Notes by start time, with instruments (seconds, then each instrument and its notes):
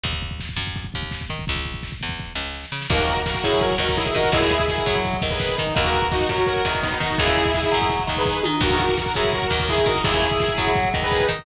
0.03 electric bass (finger) D#2, kick, closed hi-hat
0.13 kick
0.22 kick
0.31 kick
0.40 kick, snare
0.49 kick
0.56 electric bass (finger) F#2, kick
0.67 kick
0.76 kick, closed hi-hat
0.84 kick
0.94 electric bass (finger) D#2, kick
1.03 kick
1.11 kick, snare
1.21 kick
1.30 electric bass (finger) D#3, kick
1.39 kick
1.47 electric bass (finger) C#2, kick, closed hi-hat
1.56 kick
1.65 kick
1.74 kick
1.83 kick, snare
1.92 kick
2.01 electric bass (finger) E2, kick
2.09 kick
2.18 kick, snare
2.35 electric bass (finger) C#2, snare
2.54 snare
2.64 snare
2.72 electric bass (finger) C#3, snare
2.81 snare
2.90 electric bass (finger) D#2, overdriven guitar D#3 A#3, lead 2 (sawtooth) F#4 A#4, kick, crash
2.99 kick
3.08 kick, closed hi-hat
3.17 kick
3.26 lead 2 (sawtooth) F#4 A#4, kick, snare
3.35 kick
3.44 electric bass (finger) F#2, overdriven guitar F#3, lead 2 (sawtooth) E4 G#4, kick, closed hi-hat
3.53 kick
3.61 lead 2 (sawtooth) F#4 A#4, kick, closed hi-hat
3.71 kick
3.78 electric bass (finger) D#2, overdriven guitar D#3, kick, closed hi-hat
3.89 kick
3.97 lead 2 (sawtooth) E4 G#4, kick, snare
4.06 kick
4.15 electric bass (finger) D#3, overdriven guitar D#4, lead 2 (sawtooth) F#4 A#4, kick, closed hi-hat
4.24 kick
4.32 electric bass (finger) D#2, overdriven guitar C#3 G#3, lead 2 (sawtooth) E4 G#4, kick, closed hi-hat
4.42 kick
4.51 kick, closed hi-hat
4.60 kick
4.68 lead 2 (sawtooth) E4 G#4, kick, snare
4.78 kick
4.86 electric bass (finger) F#2, overdriven guitar F#3, kick, closed hi-hat
4.95 kick
5.04 kick, closed hi-hat
5.14 kick
5.22 electric bass (finger) D#2, overdriven guitar D#3, kick, closed hi-hat
5.30 lead 2 (sawtooth) G#4 B4, kick
5.40 kick, snare
5.49 kick
5.58 electric bass (finger) D#3, overdriven guitar D#4, kick, open hi-hat
5.67 kick
5.75 electric bass (finger) D#2, overdriven guitar D#3 A#3, lead 2 (sawtooth) F#4 A#4, kick, closed hi-hat
5.85 kick
5.93 kick, closed hi-hat
6.02 kick
6.12 lead 2 (sawtooth) D#4 F#4, kick, snare
6.21 kick
6.29 electric bass (finger) F#2, overdriven guitar F#3, lead 2 (sawtooth) F#4 A#4, kick, closed hi-hat
6.38 kick
6.47 lead 2 (sawtooth) F#4 A#4, kick, closed hi-hat
6.56 kick
6.65 electric bass (finger) E2, overdriven guitar D#3, kick, closed hi-hat
6.75 kick
6.82 lead 2 (sawtooth) B3 D#4, kick, snare
6.92 kick
7.00 electric bass (finger) D#3, overdriven guitar D#4, lead 2 (sawtooth) D#4 F#4, kick, closed hi-hat
7.10 kick
7.18 electric bass (finger) D#2, overdriven guitar C#3 G#3, lead 2 (sawtooth) E4 G#4, kick, closed hi-hat
7.27 kick
7.37 kick, closed hi-hat
7.45 kick
7.54 lead 2 (sawtooth) E4 G#4, kick, snare
7.63 kick
7.72 electric bass (finger) F#2, overdriven guitar F#3, kick, closed hi-hat
7.82 kick
7.90 kick, closed hi-hat
7.99 kick
8.07 electric bass (finger) D#2, overdriven guitar D#3, kick, closed hi-hat
8.17 lead 2 (sawtooth) G#4 B4, kick
8.25 kick
8.43 electric bass (finger) D#3, overdriven guitar D#4, high tom
8.61 electric bass (finger) D#2, overdriven guitar D#3 A#3, lead 2 (sawtooth) F#4 A#4, kick, crash
8.70 kick
8.79 kick, closed hi-hat
8.89 kick
8.97 lead 2 (sawtooth) F#4 A#4, kick, snare
9.06 kick
9.14 electric bass (finger) F#2, overdriven guitar F#3, lead 2 (sawtooth) E4 G#4, kick, closed hi-hat
9.24 kick
9.32 lead 2 (sawtooth) F#4 A#4, kick, closed hi-hat
9.42 kick
9.50 electric bass (finger) D#2, overdriven guitar D#3, kick, closed hi-hat
9.60 kick
9.69 lead 2 (sawtooth) E4 G#4, kick, snare
9.78 kick
9.86 electric bass (finger) D#3, overdriven guitar D#4, lead 2 (sawtooth) F#4 A#4, kick, closed hi-hat
9.96 kick
10.04 electric bass (finger) D#2, overdriven guitar C#3 G#3, lead 2 (sawtooth) E4 G#4, kick, closed hi-hat
10.14 kick
10.22 kick, closed hi-hat
10.31 kick
10.40 lead 2 (sawtooth) E4 G#4, kick, snare
10.48 kick
10.58 electric bass (finger) F#2, overdriven guitar F#3, kick, closed hi-hat
10.67 kick
10.76 kick, closed hi-hat
10.85 kick
10.93 electric bass (finger) D#2, overdriven guitar D#3, kick, closed hi-hat
11.02 lead 2 (sawtooth) G#4 B4, kick
11.11 kick, snare
11.20 kick
11.28 electric bass (finger) D#3, overdriven guitar D#4, kick, closed hi-hat
11.39 kick